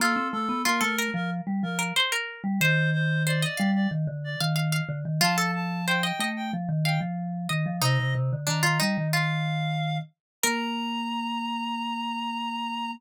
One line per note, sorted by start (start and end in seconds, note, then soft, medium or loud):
0.00 0.16 A#3 loud
0.00 0.58 F4 medium
0.00 0.28 A4 medium
0.16 0.32 C4 loud
0.32 0.49 A3 loud
0.32 0.62 A4 medium
0.49 0.64 B3 loud
0.65 0.81 A#3 loud
0.65 0.81 F4 medium
0.65 0.81 A#4 medium
0.81 1.08 A3 loud
0.81 0.96 A4 medium
0.81 1.10 A#4 medium
0.99 1.72 A#4 medium
1.14 1.41 F3 loud
1.14 1.30 A#4 medium
1.47 1.62 G3 loud
1.63 1.92 F3 medium
1.63 1.79 A#4 medium
1.79 1.94 A#4 medium
1.96 2.12 C5 medium
2.12 2.42 A#4 medium
2.44 2.59 G3 loud
2.61 3.45 D#3 loud
2.61 3.16 C5 medium
2.61 2.90 C5 medium
2.93 3.23 C5 medium
3.26 3.42 C5 medium
3.26 3.42 D5 medium
3.42 3.71 D5 medium
3.42 3.58 D#5 medium
3.57 3.87 G3 loud
3.57 4.33 F5 medium
3.75 3.90 D5 medium
3.91 4.07 D#3 loud
4.07 4.36 D3 loud
4.24 4.40 D5 medium
4.40 4.81 D#3 loud
4.40 4.55 F5 medium
4.56 4.71 F5 medium
4.72 4.99 F5 medium
4.89 5.04 D3 loud
5.05 5.21 D#3 loud
5.21 6.12 F3 loud
5.21 5.36 F4 medium
5.21 5.51 A5 medium
5.38 5.82 A4 medium
5.55 5.86 A5 medium
5.86 6.03 C5 medium
5.86 6.02 G5 medium
6.03 6.19 D#5 medium
6.03 6.29 G5 medium
6.19 6.51 A3 loud
6.19 6.47 D#5 medium
6.36 6.52 G5 medium
6.53 6.69 F3 loud
6.69 6.99 D#3 loud
6.84 7.42 F5 medium
6.84 7.00 G5 medium
7.01 7.47 F3 loud
7.49 7.66 D#3 loud
7.49 7.77 D#5 medium
7.66 7.82 F3 loud
7.82 7.97 C3 loud
7.82 8.36 D#4 medium
7.82 8.14 D#5 medium
8.00 8.15 C3 loud
8.15 8.31 C3 loud
8.33 8.48 D3 loud
8.47 8.63 D#3 medium
8.47 8.62 D4 medium
8.47 8.79 A#5 medium
8.63 8.79 D#3 medium
8.63 8.78 F4 medium
8.80 8.97 G3 loud
8.80 9.08 D#4 medium
8.97 9.99 D#3 medium
9.13 9.76 F4 medium
9.13 9.98 F5 medium
10.43 12.92 A#3 loud
10.43 12.92 A#4 loud
10.43 12.91 A#5 loud